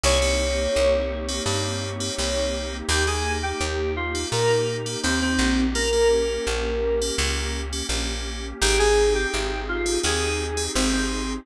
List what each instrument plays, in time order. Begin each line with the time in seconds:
0.04 electric bass (finger) C2, electric piano 2 A#3 C4 D#4 G4 C#5, pad 2 (warm) A#3 C4 D#4 G4
0.22 electric piano 2 A#3 C4 D#4 G4
0.76 electric bass (finger) C2
1.29 electric piano 2 A#3 C4 D#4 G4
1.46 electric bass (finger) G2, electric piano 2 A#3 C4 D#4 G4
2.00 electric piano 2 A#3 C4 D#4 G4
2.18 electric bass (finger) C2, electric piano 2 A#3 C4 D#4 G4
2.89 electric bass (finger) D#2, electric piano 2 A#3 D#4 G4, pad 2 (warm) A#3 D#4 G4
3.07 electric piano 2 A#3 D#4 G4 G#4
3.43 electric piano 2 G4
3.61 electric bass (finger) D#2
3.96 electric piano 2 F4
4.15 electric piano 2 A#3 D#4 G4
4.32 electric bass (finger) A#2, electric piano 2 A#3 D#4 G4 A#4
4.86 electric piano 2 A#3 D#4 G4
5.03 electric bass (finger) D#2, electric piano 2 A#3 C4 D#4 G4
5.22 electric piano 2 C4
5.39 electric bass (finger) A#1
5.75 electric piano 2 A#3 C#4 G4 A#4, pad 2 (warm) A#3 C#4 G4
5.93 electric piano 2 A#3 C#4 G4
6.47 electric bass (finger) A#1
7.01 electric piano 2 A#3 C#4 G4
7.18 electric bass (finger) C#2, electric piano 2 A#3 C#4 G4
7.73 electric piano 2 A#3 C#4 G4
7.89 electric bass (finger) A#1, electric piano 2 A#3 C#4 G4
8.61 electric bass (finger) G#1, electric piano 2 C4 D#4 G4 G#4, pad 2 (warm) C4 D#4 G4 G#4
8.79 electric piano 2 C4 D#4 G4 G#4
9.15 electric piano 2 G4
9.34 electric bass (finger) G#1
9.68 electric piano 2 F4
9.86 electric piano 2 C4 D#4 G4 G#4
10.03 electric bass (finger) D#2, electric piano 2 C4 D#4 G4 G#4
10.57 electric piano 2 C4 D#4 G4 G#4
10.75 electric bass (finger) G#1, electric piano 2 C4 D#4 G4 G#4
10.93 electric piano 2 C4